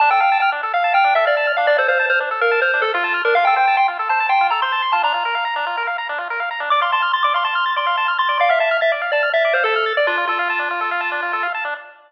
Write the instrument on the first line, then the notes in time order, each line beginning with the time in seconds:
lead 1 (square)
0.00 D4 A5
0.10 A4 G5
0.20 F5 G5
0.32 A5
0.40 G5 F6
0.52 D4
0.63 A4
0.74 F5
0.84 A5
0.94 G5 F6
1.04 D4
1.15 A4 E5
1.26 D5 F5
1.37 A5
1.47 F6
1.57 D4 F5
1.67 D4 D5
1.78 A4 C5
1.88 C5 F5
1.99 A5
2.10 C5 F6
2.20 D4
2.31 A4
2.41 A#4 F5
2.51 A5
2.62 C5 F6
2.74 D4
2.82 A4
2.94 F4 F5
3.04 A5
3.14 F6
3.25 D4 A#4
3.35 F4 F5
3.45 A4 G5
3.56 C5 G5
3.67 A5
3.77 G5 C6
3.88 F4
3.99 A4
4.09 C5 A5
4.20 A5
4.29 G5 C6
4.41 F4
4.50 A4 A#5
4.62 C5 C6
4.72 A5
4.82 C6
4.92 F4 A5
5.03 D4 A#5
5.14 F4
5.25 A#4
5.35 F5
5.45 A#5
5.56 D4
5.67 F4
5.77 A#4
5.87 F5
5.98 A#5
6.09 D4
6.18 F4
6.30 A#4
6.40 F5
6.51 A#5
6.60 D4
6.70 D5 D6
6.81 F5 C6
6.92 A5 C6
7.02 F6
7.13 C6 A6
7.23 D5 D6
7.34 F5 C6
7.44 A5 C6
7.55 F6
7.66 A6
7.76 D5 C6
7.87 F5
7.97 A5
8.08 F6
8.18 C6 A6
8.29 D5
8.39 D5 F5
8.49 E5 F5
8.59 E5 A5
8.71 F6
8.81 E5 A6
8.92 D5
9.02 F5
9.12 D5 A5
9.23 F6
9.33 E5 A6
9.45 D5
9.53 C5 F5
9.64 A4 A5
9.76 F6
9.86 A6
9.97 D5
10.07 D4 F4
10.17 F4
10.27 F4 A4
10.39 F5
10.50 A5
10.59 D4
10.71 F4
10.81 A4
10.91 F5
11.01 A5
11.12 D4
11.22 F4
11.33 A4
11.43 F5
11.54 A5
11.65 D4